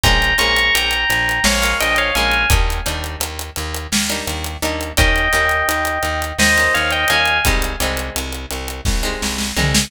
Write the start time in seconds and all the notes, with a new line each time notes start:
0.04 A#1 G#3 A#3 C#4 F4 G5 A#5, kick, closed hi-hat
0.22 closed hi-hat
0.38 A#1 G#3 A#3 C#4 F4 A#5 C#6, closed hi-hat
0.56 closed hi-hat
0.75 A#1 G5 A#5, closed hi-hat
0.91 closed hi-hat
1.10 A#1, closed hi-hat
1.29 closed hi-hat
1.44 A#1 C#5 F5, snare
1.62 G#3 A#3 C#4 F4, closed hi-hat
1.80 A#1 D#5 G5, closed hi-hat
1.96 C#5 F5, closed hi-hat
2.15 A#1 G#3 A#3 C#4 F4 F5 G#5, closed hi-hat
2.31 closed hi-hat
2.50 D#2 G3 A#3 D4 D#4, kick, closed hi-hat
2.70 closed hi-hat
2.86 D#2 G3 A#3 D4 D#4, closed hi-hat
3.04 closed hi-hat
3.20 D#2, closed hi-hat
3.39 closed hi-hat
3.56 D#2, closed hi-hat
3.75 closed hi-hat
3.92 D#2, snare
4.10 G3 A#3 D4 D#4, closed hi-hat
4.27 D#2, closed hi-hat
4.44 closed hi-hat
4.62 D#2 G3 A#3 D4 D#4, closed hi-hat
4.81 closed hi-hat
4.97 D#2 G3 A#3 C#4 D#4 D#5 G5, kick, closed hi-hat
5.16 closed hi-hat
5.33 D#2 G3 A#3 C#4 D#4, closed hi-hat
5.49 closed hi-hat
5.69 D#2, closed hi-hat
5.85 closed hi-hat
6.03 D#2, closed hi-hat
6.22 closed hi-hat
6.39 D#2 C5 D#5, snare
6.57 G3 A#3 C#4 D#4, closed hi-hat
6.74 D#2 C#5 F5, closed hi-hat
6.91 D#5 G5, closed hi-hat
7.08 D#2 G3 A#3 C#4 D#4 F5 G#5, closed hi-hat
7.26 closed hi-hat
7.45 C2 G3 G#3 C4 D#4, kick, closed hi-hat
7.62 closed hi-hat
7.80 C2 G3 G#3 C4 D#4, closed hi-hat
7.97 closed hi-hat
8.16 C2, closed hi-hat
8.32 closed hi-hat
8.51 C2, closed hi-hat
8.68 closed hi-hat
8.85 C2, kick, snare
9.03 G3 G#3 C4 D#4
9.22 C2, snare
9.38 snare
9.56 C2 G3 G#3 C4 D#4, floor tom
9.75 snare